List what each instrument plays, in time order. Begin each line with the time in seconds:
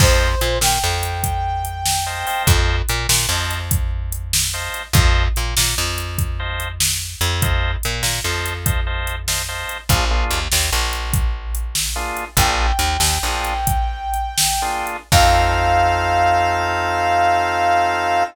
0.00 electric bass (finger) F2, drawbar organ C5 D#5 F5 A5, brass section C5, kick, crash
0.41 electric bass (finger) A#2, closed hi-hat
0.61 electric bass (finger) A#2, brass section G5, snare
0.84 electric bass (finger) F2
1.03 closed hi-hat
1.24 kick, closed hi-hat
1.65 closed hi-hat
1.86 snare
2.06 drawbar organ C5 D#5 F5 A5
2.27 drawbar organ C5 D#5 F5 A5, open hi-hat
2.47 electric bass (finger) F2, kick, closed hi-hat
2.89 electric bass (finger) A#2, closed hi-hat
3.09 electric bass (finger) A#2, snare
3.29 electric bass (finger) F2, drawbar organ C5 D#5 F5 A5
3.51 closed hi-hat
3.71 kick, closed hi-hat
4.12 closed hi-hat
4.33 snare
4.54 drawbar organ C5 D#5 F5 A5
4.74 closed hi-hat
4.93 electric bass (finger) F2, drawbar organ C5 D#5 F5 A5, kick, closed hi-hat
5.36 electric bass (finger) A#2, closed hi-hat
5.57 electric bass (finger) A#2, snare
5.78 electric bass (finger) F2
5.98 closed hi-hat
6.18 kick, closed hi-hat
6.39 drawbar organ C5 D#5 F5 A5
6.60 closed hi-hat
6.80 snare
7.21 electric bass (finger) F2, closed hi-hat
7.42 drawbar organ C5 D#5 F5 A5, kick, closed hi-hat
7.83 electric bass (finger) A#2, closed hi-hat
8.03 electric bass (finger) A#2, snare
8.24 electric bass (finger) F2, drawbar organ C5 D#5 F5 A5
8.46 closed hi-hat
8.66 drawbar organ C5 D#5 F5 A5, kick, closed hi-hat
8.87 drawbar organ C5 D#5 F5 A5
9.07 closed hi-hat
9.28 drawbar organ C5 D#5 F5 A5, snare
9.48 drawbar organ C5 D#5 F5 A5
9.69 closed hi-hat
9.89 electric bass (finger) A#1, drawbar organ A#3 D4 F4 G#4, kick, closed hi-hat
10.11 drawbar organ A#3 D4 F4 G#4
10.30 electric bass (finger) D#2, closed hi-hat
10.52 electric bass (finger) D#2, snare
10.73 electric bass (finger) A#1
10.93 closed hi-hat
11.13 kick, closed hi-hat
11.55 closed hi-hat
11.75 snare
11.96 drawbar organ A#3 D4 F4 G#4
12.17 closed hi-hat
12.37 electric bass (finger) A#1, drawbar organ A#3 D4 F4 G#4, brass section G5, kick, closed hi-hat
12.79 electric bass (finger) D#2, closed hi-hat
13.00 electric bass (finger) D#2, snare
13.23 electric bass (finger) A#1, drawbar organ A#3 D4 F4 G#4
13.45 closed hi-hat
13.67 kick, closed hi-hat
14.14 closed hi-hat
14.38 snare
14.62 drawbar organ A#3 D4 F4 G#4
14.87 closed hi-hat
15.12 electric bass (finger) F2, drawbar organ C4 D#4 F4 A4, brass section F5, kick, crash